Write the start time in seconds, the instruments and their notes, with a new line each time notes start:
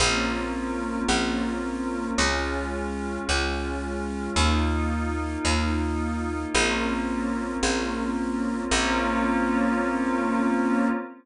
0.00 electric bass (finger) A#1, pad 5 (bowed) A#3 C4 C#4 F4
1.08 electric bass (finger) A#1
2.18 electric bass (finger) C#2, pad 5 (bowed) G#3 C#4 F4
3.29 electric bass (finger) C#2
4.36 electric bass (finger) D#2, pad 5 (bowed) A#3 D#4 F4
5.45 electric bass (finger) D#2
6.54 electric bass (finger) A#1, pad 5 (bowed) A#3 C4 C#4 F4
7.63 electric bass (finger) A#1
8.71 electric bass (finger) A#1, pad 5 (bowed) A#3 C4 C#4 F4